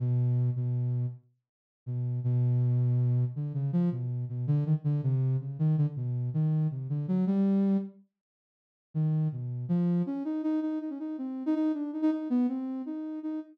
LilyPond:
\new Staff { \time 6/8 \tempo 4. = 107 b,4. b,4. | r2 b,4 | b,2. | d8 des8 f8 b,4 b,8 |
d8 ees16 r16 d8 c4 des8 | ees8 d16 r16 b,4 ees4 | c8 d8 ges8 g4. | r2. |
ees4 b,4 f4 | des'8 ees'8 ees'8 ees'8 ees'16 des'16 ees'8 | c'8. ees'16 ees'8 d'8 ees'16 ees'16 ees'8 | b8 c'4 ees'4 ees'8 | }